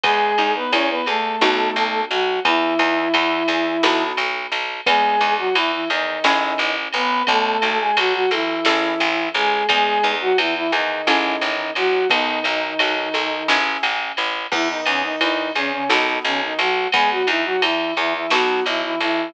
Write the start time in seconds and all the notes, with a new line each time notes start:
0.03 E2 G#3 B3 G#4, kick, ride
0.38 E2 D#4, ride
0.55 B3 B4
0.72 E2 C#4 E4 C#5, ride
0.90 B3 B4
1.06 E2 A3 G#4 A4, ride
1.41 B1 B3 D#4 F#4 A4, snare
1.76 B1, ride
2.10 B1 F#3 F#4, ride
2.45 E2 E3 B3 E4, kick, ride
2.79 E2 D#4, ride
3.14 E2 E4, ride
3.48 E2 G#4, ride
3.83 B1 B3 D#4 F#4 A4, snare
4.17 B1, ride
4.52 B1, ride
4.86 E2 G#3 B3 G#4, kick, ride
5.21 E2 D#4, ride
5.38 F#3 F#4
5.55 E2 E3 E4, ride
5.72 E3 E4
5.90 E2 D#3 D#4 G#4, ride
6.24 A1 C#4 E4 G#4 A4, snare
6.58 A1, ride
6.93 A1 B3 B4, ride
7.27 B1 A3 B3 A4, kick, ride
7.62 B1 D#4, ride
7.79 G#3 G#4
7.97 B1 F#3 F#4, ride
8.14 F#3 F#4
8.31 B1 E3 E4 A4, ride
8.65 A1 C#4 E4 G#4 A4, snare
9.00 A1, ride
9.34 A1 G#3 G#4, ride
9.69 E2 G#3 B3 G#4, kick, ride
10.03 E2 D#4, ride
10.21 F#3 F#4
10.38 E2 E3 E4, ride
10.55 E3 E4
10.72 E2 D#3 D#4 G#4, ride
11.07 A1 C#4 E4 G#4 A4, snare
11.41 A1, ride
11.75 A1 F#3 F#4, ride
12.10 B1 D#3 B3 D#4, kick, ride
12.44 B1 D#4, ride
12.79 B1 F#4, ride
13.14 B1 A4, ride
13.48 A1 C#4 E4 G#4 A4, snare
13.83 A1, ride
14.17 A1, ride
14.52 E2 E3 B3 E4, kick, crash
14.69 D#3 D#4
14.86 E2 C#3 C#4 D#4, ride
15.03 D#3 D#4
15.21 E2 D#3 D#4 E4, ride
15.55 E2 C#3 C#4 G#4, ride
15.73 C#3 C#4
15.89 B1 D#3 B3 D#4 F#4 A4, snare
16.25 B1 C#3 C#4, ride
16.42 D#3 D#4
16.59 B1 F#3 F#4, ride
16.92 E2 G#3 B3 G#4, kick, ride
17.11 F#3 F#4
17.27 E2 E3 D#4 E4, ride
17.45 F#3 F#4
17.62 E2 E3 E4, ride
17.97 E2 E3 E4 G#4, ride
18.14 E3 E4
18.30 B1 F#3 B3 D#4 F#4 A4, snare
18.66 B1 E3 E4, ride
18.83 E3 E4
19.00 B1 E3 E4, ride